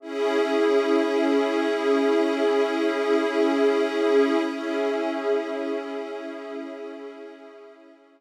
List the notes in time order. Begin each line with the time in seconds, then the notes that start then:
0.00 C#4 E4 G#4 E5
4.45 C#4 E4 G#4 E5